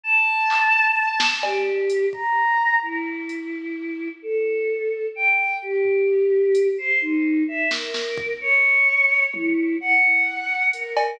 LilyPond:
<<
  \new Staff \with { instrumentName = "Choir Aahs" } { \time 6/8 \tempo 4. = 86 a''2. | g'4. bes''4. | e'2. | a'2 g''4 |
g'2~ g'8 c''8 | ees'4 e''8 bes'4. | des''2 e'4 | ges''2 bes'4 | }
  \new DrumStaff \with { instrumentName = "Drums" } \drummode { \time 6/8 r4 hc8 r4 sn8 | cb4 hh8 bd4. | r4 hh8 r4. | r4. r4. |
r8 tomfh4 r8 hh4 | r4. sn8 sn8 bd8 | r4. r8 tommh4 | r4. r8 hh8 cb8 | }
>>